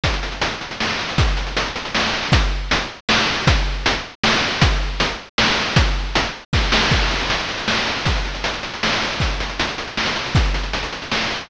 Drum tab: CC |------------|------------|------------|------------|
HH |xxxxxxxx-xxx|xxxxxxxx-xxx|x---x-------|x---x-------|
SD |--------o---|--------o---|--------o---|--------o---|
BD |o-----------|o-----------|o-----------|o-----------|

CC |------------|------------|x-----------|------------|
HH |x---x-------|x---x-------|-xxxxxxx-xxx|xxxxxxxx-xxx|
SD |--------o---|--------o-o-|--------o---|--------o---|
BD |o-----------|o-------o---|o-----------|o-----------|

CC |------------|------------|
HH |xxxxxxxx-xxx|xxxxxxxx-xxx|
SD |--------o---|--------o---|
BD |o-----------|o-----------|